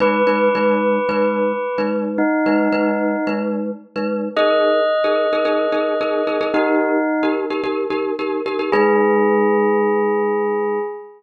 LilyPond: <<
  \new Staff \with { instrumentName = "Tubular Bells" } { \time 4/4 \key gis \minor \tempo 4 = 110 b'1 | dis'2 r2 | dis''1 | dis'4. r2 r8 |
gis'1 | }
  \new Staff \with { instrumentName = "Glockenspiel" } { \time 4/4 \key gis \minor <gis dis' b'>8 <gis dis' b'>8 <gis dis' b'>4 <gis dis' b'>4~ <gis dis' b'>16 <gis dis' b'>8.~ | <gis dis' b'>8 <gis dis' b'>8 <gis dis' b'>4 <gis dis' b'>4~ <gis dis' b'>16 <gis dis' b'>8. | <dis' gis' ais'>4~ <dis' gis' ais'>16 <dis' gis' ais'>8 <dis' gis' ais'>16 <dis' gis' ais'>8 <dis' gis' ais'>8 <dis' gis' ais'>8 <dis' gis' ais'>16 <dis' gis' ais'>16 | <dis' g' ais'>4~ <dis' g' ais'>16 <dis' g' ais'>8 <dis' g' ais'>16 <dis' g' ais'>8 <dis' g' ais'>8 <dis' g' ais'>8 <dis' g' ais'>16 <dis' g' ais'>16 |
<gis dis' b'>1 | }
>>